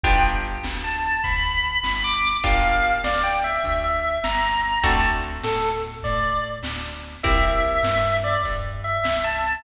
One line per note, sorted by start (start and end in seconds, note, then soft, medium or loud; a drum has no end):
0.04 0.58 G1 loud
0.04 2.20 B3 medium
0.04 2.20 D4 medium
0.04 2.20 F4 medium
0.04 2.20 G4 medium
0.04 0.23 G5 loud
0.04 kick loud
0.04 closed hi-hat medium
0.23 closed hi-hat medium
0.43 closed hi-hat medium
0.63 1.17 D2 medium
0.63 snare loud
0.83 1.20 A5 medium
0.83 closed hi-hat medium
1.24 1.79 D2 medium
1.24 1.79 B5 medium
1.24 kick medium
1.24 closed hi-hat medium
1.43 closed hi-hat medium
1.65 closed hi-hat medium
1.83 2.37 G1 medium
1.83 2.00 B5 medium
1.83 snare loud
2.03 2.38 D6 medium
2.03 closed hi-hat medium
2.24 closed hi-hat medium
2.44 2.98 G1 medium
2.44 4.60 A#3 medium
2.44 4.60 D4 medium
2.44 4.60 F4 medium
2.44 4.60 G4 medium
2.44 2.92 F5 loud
2.44 kick loud
2.62 closed hi-hat medium
2.85 closed hi-hat medium
3.04 3.59 D2 medium
3.04 3.22 D5 medium
3.04 snare loud
3.23 3.41 G5 medium
3.23 closed hi-hat medium
3.44 3.79 E5 medium
3.44 closed hi-hat medium
3.63 4.18 D2 medium
3.63 kick medium
3.63 closed hi-hat medium
3.83 4.19 E5 medium
3.83 closed hi-hat medium
4.04 closed hi-hat medium
4.24 4.78 G1 medium
4.24 4.79 A#5 medium
4.24 snare loud
4.43 closed hi-hat medium
4.64 closed hi-hat medium
4.83 5.38 D2 loud
4.83 7.00 A3 medium
4.83 7.00 C4 medium
4.83 7.00 D4 medium
4.83 7.00 F#4 medium
4.83 5.01 A5 loud
4.83 kick loud
4.83 closed hi-hat loud
5.04 closed hi-hat medium
5.25 closed hi-hat medium
5.44 5.98 A2 medium
5.44 5.69 A4 medium
5.44 snare loud
5.63 closed hi-hat medium
5.83 closed hi-hat medium
6.03 6.59 A2 medium
6.03 6.40 D5 medium
6.03 kick medium
6.03 closed hi-hat loud
6.23 closed hi-hat medium
6.44 closed hi-hat medium
6.63 7.17 D2 medium
6.63 snare loud
6.85 closed hi-hat medium
7.02 closed hi-hat medium
7.23 7.78 C2 medium
7.23 9.40 A#3 medium
7.23 9.40 C4 medium
7.23 9.40 E4 medium
7.23 9.40 G4 medium
7.23 8.17 E5 loud
7.23 kick loud
7.23 closed hi-hat loud
7.43 closed hi-hat medium
7.64 closed hi-hat medium
7.83 8.37 G2 medium
7.83 snare loud
8.03 closed hi-hat medium
8.24 8.42 D5 medium
8.24 closed hi-hat medium
8.44 8.99 G2 medium
8.44 kick medium
8.44 closed hi-hat loud
8.64 closed hi-hat medium
8.83 9.20 E5 medium
8.83 closed hi-hat medium
9.04 9.58 C2 medium
9.04 snare loud
9.23 9.60 A5 medium
9.23 closed hi-hat medium
9.44 closed hi-hat medium